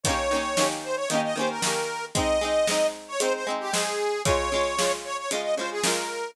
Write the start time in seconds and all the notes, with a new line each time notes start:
0.04 D#3 A#3 C#5, kick, closed hi-hat
0.09 C#4 G4
0.31 D#3 A#3 C#4
0.36 G4
0.57 D#3 A#3 C#4, snare
0.63 G4
0.84 C5
0.96 C#5
1.08 D#3 A#3 D#5, closed hi-hat
1.14 C#4 G4
1.24 D#5
1.36 D#3 A#3 C#4 C5
1.41 G4
1.50 A#4
1.62 D#3 A#3 C#4 A#4, snare
1.67 G4
2.15 G#3 C4 D#4 D#5, kick, closed hi-hat
2.41 G#3 C4 D#4
2.67 G#3 C4, snare
2.72 D#4
3.08 C#5
3.20 G#3 C4 D#4 C5, closed hi-hat
3.34 C5
3.47 G#3 C4 D#4
3.60 G4
3.73 G#3 C4 D#4 G#4, snare
4.25 C#3 G#3 C#5, kick, closed hi-hat
4.29 F4
4.52 C#3 G#3 F4
4.79 C#3 G#3 F4, snare
5.04 C#5
5.18 C#5
5.31 C#3 G#3 F4 D#5, closed hi-hat
5.42 D#5
5.57 C#3 G#3 F4 C5
5.71 G#4
5.83 C#3 G#3 A#4, snare
5.87 F4